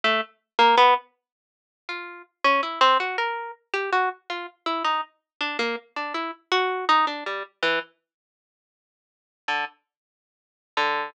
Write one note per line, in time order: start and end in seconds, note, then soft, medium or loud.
0.04 0.21 A3 loud
0.59 0.75 A#3 loud
0.77 0.94 B3 loud
1.89 2.22 F4 medium
2.44 2.61 C#4 loud
2.63 2.79 E4 medium
2.81 2.98 C4 loud
3.00 3.17 F#4 medium
3.18 3.51 A#4 medium
3.74 3.90 G4 loud
3.93 4.09 F#4 medium
4.30 4.46 F4 medium
4.66 4.83 E4 medium
4.85 5.01 D#4 medium
5.41 5.57 D4 medium
5.59 5.76 A#3 medium
5.96 6.13 D4 medium
6.14 6.31 E4 medium
6.52 6.85 F#4 loud
6.89 7.06 D#4 loud
7.07 7.24 D4 medium
7.26 7.43 G3 medium
7.63 7.79 E3 medium
9.48 9.65 D3 medium
10.77 11.10 D3 medium